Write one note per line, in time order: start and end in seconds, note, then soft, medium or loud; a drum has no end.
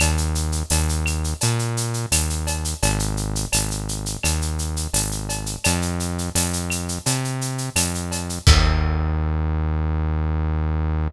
0.00 0.63 D#2 loud
0.00 cowbell medium
0.00 claves medium
0.00 shaker medium
0.17 shaker medium
0.35 shaker medium
0.52 shaker medium
0.70 1.34 D#2 medium
0.70 tambourine medium
0.70 cowbell medium
0.70 shaker medium
0.89 shaker medium
1.06 claves medium
1.06 shaker medium
1.24 shaker medium
1.41 2.06 A#2 medium
1.41 cowbell medium
1.41 shaker medium
1.59 shaker medium
1.77 shaker medium
1.94 shaker medium
2.11 2.75 D#2 medium
2.11 tambourine medium
2.11 cowbell medium
2.11 claves medium
2.11 shaker loud
2.30 shaker medium
2.47 cowbell medium
2.47 shaker medium
2.65 shaker medium
2.82 3.46 G#1 loud
2.82 cowbell medium
2.82 shaker medium
2.99 shaker medium
3.17 shaker medium
3.35 shaker medium
3.52 4.17 G#1 medium
3.52 tambourine medium
3.52 cowbell medium
3.52 claves medium
3.52 shaker loud
3.71 shaker medium
3.89 shaker medium
4.06 shaker medium
4.23 4.87 D#2 medium
4.23 cowbell medium
4.23 claves medium
4.23 shaker medium
4.42 shaker medium
4.59 shaker medium
4.76 shaker medium
4.93 5.57 G#1 medium
4.93 tambourine medium
4.93 cowbell medium
4.93 shaker medium
5.11 shaker medium
5.29 cowbell medium
5.29 shaker medium
5.46 shaker medium
5.64 6.30 F2 loud
5.64 cowbell medium
5.64 claves medium
5.64 shaker loud
5.82 shaker medium
6.00 shaker medium
6.18 shaker medium
6.35 6.99 F2 medium
6.35 tambourine medium
6.35 cowbell medium
6.35 shaker medium
6.53 shaker medium
6.70 claves medium
6.70 shaker medium
6.89 shaker medium
7.06 7.70 C3 medium
7.06 cowbell medium
7.06 shaker loud
7.24 shaker medium
7.41 shaker medium
7.58 shaker medium
7.76 8.39 F2 medium
7.76 tambourine medium
7.76 cowbell medium
7.76 claves medium
7.76 shaker loud
7.95 shaker medium
8.11 cowbell medium
8.11 shaker medium
8.29 shaker medium
8.47 11.08 D#2 loud
8.47 kick loud
8.47 crash loud